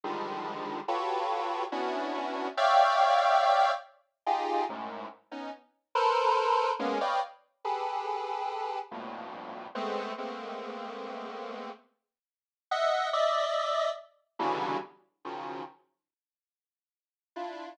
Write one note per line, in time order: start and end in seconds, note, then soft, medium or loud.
0.04 0.80 D3 medium
0.04 0.80 D#3 medium
0.04 0.80 F3 medium
0.04 0.80 G3 medium
0.04 0.80 G#3 medium
0.88 1.64 F4 medium
0.88 1.64 F#4 medium
0.88 1.64 G4 medium
0.88 1.64 A4 medium
0.88 1.64 B4 medium
0.88 1.64 C#5 medium
1.72 2.48 B3 medium
1.72 2.48 C#4 medium
1.72 2.48 D4 medium
1.72 2.48 E4 medium
1.72 2.48 F#4 medium
2.57 3.71 C#5 loud
2.57 3.71 D5 loud
2.57 3.71 E5 loud
2.57 3.71 F5 loud
2.57 3.71 G5 loud
4.26 4.64 D#4 medium
4.26 4.64 F4 medium
4.26 4.64 G4 medium
4.26 4.64 G#4 medium
4.69 5.07 F#2 medium
4.69 5.07 G#2 medium
4.69 5.07 A2 medium
5.32 5.51 B3 medium
5.32 5.51 C#4 medium
5.32 5.51 D#4 medium
5.95 6.71 A4 loud
5.95 6.71 A#4 loud
5.95 6.71 B4 loud
5.95 6.71 C5 loud
6.79 6.98 G#3 loud
6.79 6.98 A#3 loud
6.79 6.98 B3 loud
6.79 6.98 C#4 loud
7.01 7.20 B4 medium
7.01 7.20 C#5 medium
7.01 7.20 D5 medium
7.01 7.20 D#5 medium
7.01 7.20 F5 medium
7.01 7.20 G5 medium
7.65 8.79 G4 medium
7.65 8.79 G#4 medium
7.65 8.79 A4 medium
7.65 8.79 B4 medium
8.91 9.67 F2 medium
8.91 9.67 G2 medium
8.91 9.67 A2 medium
8.91 9.67 A#2 medium
8.91 9.67 B2 medium
9.75 10.13 G#3 medium
9.75 10.13 A3 medium
9.75 10.13 B3 medium
9.75 10.13 C4 medium
10.18 11.70 G#3 medium
10.18 11.70 A3 medium
10.18 11.70 A#3 medium
10.18 11.70 B3 medium
10.18 11.70 C4 medium
12.71 13.09 D#5 loud
12.71 13.09 E5 loud
12.71 13.09 F#5 loud
13.13 13.89 D5 loud
13.13 13.89 D#5 loud
13.13 13.89 E5 loud
14.39 14.77 B2 loud
14.39 14.77 C#3 loud
14.39 14.77 D3 loud
14.39 14.77 E3 loud
14.39 14.77 F#3 loud
14.39 14.77 G3 loud
15.25 15.63 C#3 medium
15.25 15.63 D#3 medium
15.25 15.63 F3 medium
15.25 15.63 F#3 medium
17.36 17.74 D4 soft
17.36 17.74 E4 soft
17.36 17.74 F4 soft